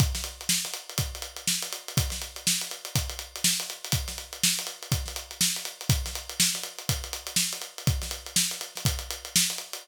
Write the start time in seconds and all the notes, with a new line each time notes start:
0.00 kick, closed hi-hat
0.15 snare, closed hi-hat
0.24 closed hi-hat
0.41 closed hi-hat
0.49 snare
0.65 snare, closed hi-hat
0.74 closed hi-hat
0.90 closed hi-hat
0.98 kick, closed hi-hat
1.15 closed hi-hat
1.22 closed hi-hat
1.36 closed hi-hat
1.47 snare
1.62 closed hi-hat
1.73 closed hi-hat
1.88 closed hi-hat
1.97 kick, closed hi-hat
2.10 snare, closed hi-hat
2.22 closed hi-hat
2.36 closed hi-hat
2.47 snare
2.61 closed hi-hat
2.71 closed hi-hat
2.85 closed hi-hat
2.95 kick, closed hi-hat
3.10 closed hi-hat
3.19 closed hi-hat
3.36 closed hi-hat
3.44 snare
3.60 closed hi-hat
3.70 closed hi-hat
3.85 closed hi-hat
3.92 kick, closed hi-hat
4.08 snare, closed hi-hat
4.18 closed hi-hat
4.33 closed hi-hat
4.43 snare
4.59 closed hi-hat
4.67 closed hi-hat
4.83 closed hi-hat
4.92 kick, closed hi-hat
5.06 snare, closed hi-hat
5.16 closed hi-hat
5.31 closed hi-hat
5.41 snare
5.56 closed hi-hat
5.65 closed hi-hat
5.81 closed hi-hat
5.89 kick, closed hi-hat
6.06 snare, closed hi-hat
6.15 closed hi-hat
6.30 closed hi-hat
6.40 snare
6.54 snare, closed hi-hat
6.63 closed hi-hat
6.78 closed hi-hat
6.89 kick, closed hi-hat
7.04 closed hi-hat
7.13 closed hi-hat
7.27 closed hi-hat
7.36 snare
7.53 closed hi-hat
7.62 closed hi-hat
7.78 closed hi-hat
7.87 kick, closed hi-hat
8.02 snare, closed hi-hat
8.11 closed hi-hat
8.26 closed hi-hat
8.36 snare
8.51 closed hi-hat
8.61 closed hi-hat
8.75 snare, closed hi-hat
8.85 kick, closed hi-hat
8.99 closed hi-hat
9.11 closed hi-hat
9.25 closed hi-hat
9.36 snare
9.50 closed hi-hat
9.58 closed hi-hat
9.73 closed hi-hat